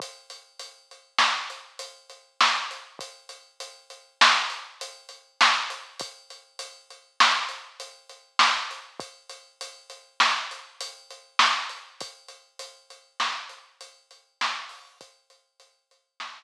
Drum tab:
HH |xxxx-xxx-x|xxxx-xxx-x|xxxx-xxx-x|xxxx-xxx-x|
SD |----o---o-|----o---o-|----o---o-|----o---o-|
BD |o---------|o---------|o---------|o---------|

HH |xxxx-xxx-o|xxxx------|
SD |----o---o-|----o-----|
BD |o---------|o---------|